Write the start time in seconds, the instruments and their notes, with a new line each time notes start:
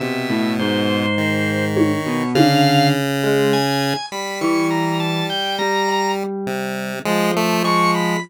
0.00 lead 1 (square) B2, electric piano 1 C3, drawbar organ E5
0.29 electric piano 1 A2
0.59 electric piano 1 G#2, drawbar organ C5
1.18 lead 1 (square) D#3
1.76 drawbar organ C#5, high tom
2.06 electric piano 1 B2
2.35 lead 1 (square) C#3, electric piano 1 D3, drawbar organ F5, high tom
3.24 electric piano 1 G#3
3.53 drawbar organ G#5
4.12 lead 1 (square) G3, drawbar organ B5
4.41 electric piano 1 E3, drawbar organ C#6
4.70 drawbar organ A#5
5.00 drawbar organ A5
5.30 drawbar organ G5
5.59 electric piano 1 G3, drawbar organ A#5
5.88 cowbell
6.47 lead 1 (square) C3
7.05 electric piano 1 F3, lead 1 (square) G#3
7.36 lead 1 (square) A3
7.64 lead 1 (square) G#3, drawbar organ C#6, cowbell
7.94 drawbar organ B5